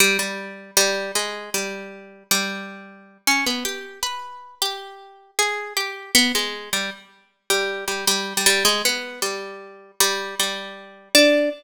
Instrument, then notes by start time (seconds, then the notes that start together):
orchestral harp
0.00 G3
0.19 G3
0.77 G3
1.15 G#3
1.54 G3
2.31 G3
3.27 C#4
3.46 B3
3.65 G4
4.03 B4
4.62 G4
5.39 G#4
5.77 G4
6.15 B3
6.35 G#3
6.73 G3
7.50 G3
7.88 G3
8.07 G3
8.37 G3
8.46 G3
8.65 G#3
8.85 B3
9.22 G3
10.00 G3
10.40 G3
11.15 D4